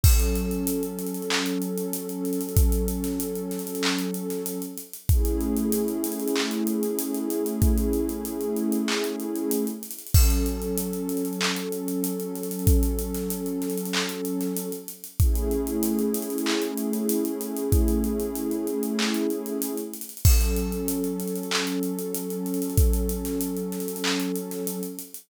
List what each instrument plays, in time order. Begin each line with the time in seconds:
0.04 pad 2 (warm) F#3 C#4 A4, kick, crash
0.20 closed hi-hat
0.36 closed hi-hat
0.51 closed hi-hat
0.67 closed hi-hat
0.83 closed hi-hat
0.99 closed hi-hat
1.07 closed hi-hat
1.14 closed hi-hat
1.22 closed hi-hat
1.30 clap
1.46 closed hi-hat
1.62 closed hi-hat
1.78 closed hi-hat
1.93 closed hi-hat
2.09 closed hi-hat
2.25 closed hi-hat
2.33 closed hi-hat
2.41 closed hi-hat
2.49 closed hi-hat
2.57 kick, closed hi-hat
2.72 closed hi-hat
2.88 closed hi-hat
3.04 snare, closed hi-hat
3.20 closed hi-hat
3.36 closed hi-hat
3.51 snare, closed hi-hat
3.59 closed hi-hat
3.67 closed hi-hat
3.75 closed hi-hat
3.83 clap
3.99 closed hi-hat
4.14 closed hi-hat
4.30 snare, closed hi-hat
4.46 closed hi-hat
4.62 closed hi-hat
4.78 closed hi-hat
4.93 closed hi-hat
5.09 pad 2 (warm) A3 C#4 E4 G#4, kick, closed hi-hat
5.25 closed hi-hat
5.41 closed hi-hat
5.57 closed hi-hat
5.72 closed hi-hat
5.88 closed hi-hat
6.04 closed hi-hat
6.12 closed hi-hat
6.20 closed hi-hat
6.28 closed hi-hat
6.36 clap
6.51 closed hi-hat
6.67 closed hi-hat
6.83 closed hi-hat
6.99 closed hi-hat
7.14 closed hi-hat
7.30 closed hi-hat
7.46 closed hi-hat
7.62 kick, closed hi-hat
7.78 closed hi-hat
7.93 closed hi-hat
8.09 closed hi-hat
8.25 closed hi-hat
8.41 closed hi-hat
8.57 closed hi-hat
8.72 closed hi-hat
8.88 clap
9.04 closed hi-hat
9.20 closed hi-hat
9.36 closed hi-hat
9.51 closed hi-hat
9.67 closed hi-hat
9.83 closed hi-hat
9.91 closed hi-hat
9.99 closed hi-hat
10.07 closed hi-hat
10.14 pad 2 (warm) F#3 C#4 A4, kick, crash
10.30 closed hi-hat
10.46 closed hi-hat
10.62 closed hi-hat
10.78 closed hi-hat
10.93 closed hi-hat
11.09 closed hi-hat
11.17 closed hi-hat
11.25 closed hi-hat
11.33 closed hi-hat
11.41 clap
11.57 closed hi-hat
11.72 closed hi-hat
11.88 closed hi-hat
12.04 closed hi-hat
12.20 closed hi-hat
12.36 closed hi-hat
12.43 closed hi-hat
12.51 closed hi-hat
12.59 closed hi-hat
12.67 kick, closed hi-hat
12.83 closed hi-hat
12.99 closed hi-hat
13.14 snare, closed hi-hat
13.30 closed hi-hat
13.46 closed hi-hat
13.62 snare, closed hi-hat
13.70 closed hi-hat
13.78 closed hi-hat
13.86 closed hi-hat
13.93 clap
14.09 closed hi-hat
14.25 closed hi-hat
14.41 snare, closed hi-hat
14.57 closed hi-hat
14.72 closed hi-hat
14.88 closed hi-hat
15.04 closed hi-hat
15.20 pad 2 (warm) A3 C#4 E4 G#4, kick, closed hi-hat
15.36 closed hi-hat
15.51 closed hi-hat
15.67 closed hi-hat
15.83 closed hi-hat
15.99 closed hi-hat
16.14 closed hi-hat
16.22 closed hi-hat
16.30 closed hi-hat
16.38 closed hi-hat
16.46 clap
16.62 closed hi-hat
16.78 closed hi-hat
16.93 closed hi-hat
17.09 closed hi-hat
17.25 closed hi-hat
17.41 closed hi-hat
17.57 closed hi-hat
17.72 kick, closed hi-hat
17.88 closed hi-hat
18.04 closed hi-hat
18.20 closed hi-hat
18.36 closed hi-hat
18.51 closed hi-hat
18.67 closed hi-hat
18.83 closed hi-hat
18.99 clap
19.14 closed hi-hat
19.30 closed hi-hat
19.46 closed hi-hat
19.62 closed hi-hat
19.78 closed hi-hat
19.94 closed hi-hat
20.01 closed hi-hat
20.09 closed hi-hat
20.17 closed hi-hat
20.25 pad 2 (warm) F#3 C#4 A4, kick, crash
20.41 closed hi-hat
20.57 closed hi-hat
20.72 closed hi-hat
20.88 closed hi-hat
21.04 closed hi-hat
21.20 closed hi-hat
21.28 closed hi-hat
21.36 closed hi-hat
21.43 closed hi-hat
21.51 clap
21.67 closed hi-hat
21.83 closed hi-hat
21.99 closed hi-hat
22.15 closed hi-hat
22.30 closed hi-hat
22.46 closed hi-hat
22.54 closed hi-hat
22.62 closed hi-hat
22.70 closed hi-hat
22.78 kick, closed hi-hat
22.93 closed hi-hat
23.09 closed hi-hat
23.25 snare, closed hi-hat
23.41 closed hi-hat
23.57 closed hi-hat
23.72 snare, closed hi-hat
23.80 closed hi-hat
23.88 closed hi-hat
23.96 closed hi-hat
24.04 clap
24.20 closed hi-hat
24.36 closed hi-hat
24.51 snare, closed hi-hat
24.67 closed hi-hat
24.83 closed hi-hat
24.99 closed hi-hat
25.14 closed hi-hat